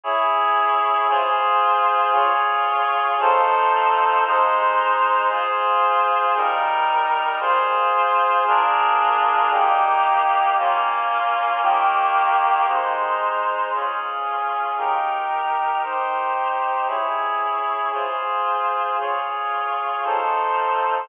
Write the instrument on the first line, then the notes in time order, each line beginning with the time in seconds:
clarinet
0.04 E4 G#4 C#5
1.09 F4 G#4 C5
2.13 F4 G#4 C#5
3.20 F3 D#4 A4 C5
4.26 G#3 D#4 C5
5.30 F4 G#4 C5
6.36 G3 D#4 A#4
7.40 F4 G#4 C5
8.47 D4 F4 G#4 A#4
9.52 A#3 D#4 G4
10.58 A#3 C#4 F4
11.62 D#3 A#3 G4
12.67 G#3 D#4 C5
13.74 C#4 F4 G#4
14.78 D#4 G4 A#4
15.83 D#4 G4 C5
16.88 E4 G#4 C#5
17.93 F4 G#4 C5
19.00 F4 G#4 C#5
20.04 F3 D#4 A4 C5